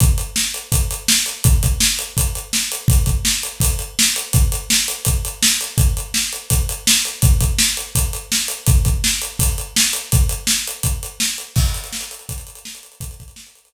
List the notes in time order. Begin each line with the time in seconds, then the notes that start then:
0.00 kick, closed hi-hat
0.18 closed hi-hat
0.36 snare
0.54 closed hi-hat
0.72 kick, closed hi-hat
0.91 closed hi-hat
1.08 snare
1.26 closed hi-hat
1.44 kick, closed hi-hat
1.63 kick, closed hi-hat
1.80 snare
1.99 closed hi-hat
2.17 kick, closed hi-hat
2.35 closed hi-hat
2.53 snare
2.72 closed hi-hat
2.88 kick, closed hi-hat
3.06 kick, closed hi-hat
3.25 snare
3.43 closed hi-hat
3.60 kick, closed hi-hat
3.79 closed hi-hat
3.99 snare
4.16 closed hi-hat
4.33 kick, closed hi-hat
4.52 closed hi-hat
4.70 snare
4.88 closed hi-hat
5.05 kick, closed hi-hat
5.25 closed hi-hat
5.43 snare
5.61 closed hi-hat
5.78 kick, closed hi-hat
5.97 closed hi-hat
6.14 snare
6.33 closed hi-hat
6.50 kick, closed hi-hat
6.69 closed hi-hat
6.87 snare
7.05 closed hi-hat
7.22 kick, closed hi-hat
7.41 kick, closed hi-hat
7.59 snare
7.77 closed hi-hat
7.95 kick, closed hi-hat
8.13 closed hi-hat
8.32 snare
8.48 closed hi-hat
8.66 kick, closed hi-hat
8.85 kick, closed hi-hat
9.04 snare
9.22 closed hi-hat
9.39 kick, closed hi-hat
9.58 closed hi-hat
9.76 snare
9.93 closed hi-hat
10.12 kick, closed hi-hat
10.29 closed hi-hat
10.47 snare
10.67 closed hi-hat
10.83 kick, closed hi-hat
11.03 closed hi-hat
11.20 snare
11.38 closed hi-hat
11.56 kick, crash
11.66 closed hi-hat
11.74 closed hi-hat
11.84 closed hi-hat
11.93 snare
12.01 closed hi-hat
12.11 closed hi-hat
12.19 closed hi-hat
12.29 kick, closed hi-hat
12.38 closed hi-hat
12.47 closed hi-hat
12.55 closed hi-hat
12.65 snare
12.75 closed hi-hat
12.83 closed hi-hat
12.92 closed hi-hat
13.00 kick, closed hi-hat
13.11 closed hi-hat
13.20 kick, closed hi-hat
13.28 closed hi-hat
13.36 snare
13.46 closed hi-hat
13.55 closed hi-hat
13.65 closed hi-hat